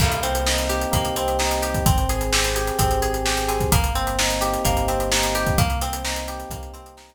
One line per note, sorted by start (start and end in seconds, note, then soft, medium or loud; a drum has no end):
0.00 0.86 C2 medium
0.00 0.21 A#3 loud
0.00 0.91 A#3 medium
0.00 kick medium
0.00 crash loud
0.12 closed hi-hat medium
0.23 0.44 C4 medium
0.23 1.16 C4 medium
0.23 closed hi-hat medium
0.35 closed hi-hat medium
0.46 1.39 D#4 medium
0.46 0.67 D#4 medium
0.46 snare medium
0.58 closed hi-hat medium
0.69 1.63 G4 medium
0.69 0.90 G4 medium
0.69 closed hi-hat medium
0.81 closed hi-hat medium
0.91 1.79 C2 medium
0.91 1.80 A#3 medium
0.91 1.14 A#3 loud
0.91 kick medium
0.91 closed hi-hat medium
1.05 closed hi-hat medium
1.16 1.37 C4 medium
1.16 1.83 C4 medium
1.16 closed hi-hat medium
1.28 closed hi-hat medium
1.39 1.60 D#4 medium
1.39 1.84 D#4 medium
1.39 snare medium
1.51 closed hi-hat medium
1.62 1.83 G4 medium
1.62 1.85 G4 medium
1.62 closed hi-hat medium
1.74 kick medium
1.74 closed hi-hat medium
1.86 2.71 G#1 medium
1.86 2.32 C4 medium
1.86 2.07 C4 loud
1.86 kick medium
1.86 closed hi-hat medium
1.98 closed hi-hat medium
2.09 3.02 G#4 medium
2.09 2.31 G#4 medium
2.09 closed hi-hat medium
2.21 closed hi-hat medium
2.33 2.78 C4 medium
2.33 2.54 G4 loud
2.33 snare loud
2.44 closed hi-hat medium
2.55 3.26 G4 medium
2.55 2.77 G#4 medium
2.55 closed hi-hat medium
2.67 closed hi-hat medium
2.79 3.65 G#1 medium
2.79 3.00 C4 medium
2.79 3.48 C4 medium
2.79 kick medium
2.79 closed hi-hat medium
2.91 closed hi-hat medium
3.02 3.23 G#4 medium
3.02 3.69 G#4 medium
3.02 closed hi-hat medium
3.14 closed hi-hat medium
3.25 3.46 G4 medium
3.25 3.70 G4 medium
3.25 snare medium
3.37 closed hi-hat medium
3.48 3.70 C4 medium
3.48 3.69 G#4 medium
3.48 closed hi-hat medium
3.60 kick medium
3.60 closed hi-hat medium
3.72 4.57 G1 medium
3.72 4.65 A#3 medium
3.72 3.93 A#3 loud
3.72 kick medium
3.72 closed hi-hat loud
3.84 closed hi-hat medium
3.95 4.87 C4 medium
3.95 4.16 C4 medium
3.95 closed hi-hat medium
4.07 closed hi-hat medium
4.19 4.40 D#4 medium
4.19 5.11 D#4 medium
4.19 snare loud
4.30 closed hi-hat medium
4.41 4.62 G4 medium
4.41 5.35 G4 medium
4.41 closed hi-hat medium
4.53 closed hi-hat medium
4.65 5.52 G1 medium
4.65 4.85 A#3 medium
4.65 5.54 A#3 medium
4.65 kick medium
4.65 closed hi-hat medium
4.77 closed hi-hat medium
4.88 5.54 C4 medium
4.88 5.09 C4 medium
4.88 closed hi-hat medium
5.00 closed hi-hat medium
5.11 5.56 D#4 medium
5.11 5.33 D#4 medium
5.11 snare loud
5.23 closed hi-hat medium
5.35 5.56 G4 medium
5.35 5.57 G4 medium
5.35 closed hi-hat medium
5.47 kick medium
5.47 closed hi-hat medium
5.58 6.44 C2 medium
5.58 6.52 A#3 medium
5.58 5.79 A#3 loud
5.58 kick medium
5.58 closed hi-hat medium
5.70 closed hi-hat medium
5.81 6.75 C4 medium
5.81 6.03 C4 medium
5.81 closed hi-hat medium
5.93 closed hi-hat medium
6.05 6.26 D#4 medium
6.05 6.97 D#4 medium
6.05 snare loud
6.16 closed hi-hat medium
6.28 7.15 G4 medium
6.28 6.49 G4 medium
6.28 closed hi-hat medium
6.40 closed hi-hat medium
6.50 7.15 C2 medium
6.50 6.72 A#3 medium
6.50 7.15 A#3 medium
6.50 kick medium
6.50 closed hi-hat medium
6.63 closed hi-hat medium
6.74 6.94 C4 medium
6.74 7.15 C4 medium
6.74 closed hi-hat medium
6.86 closed hi-hat medium
6.97 7.15 D#4 medium
6.97 snare medium
7.09 closed hi-hat medium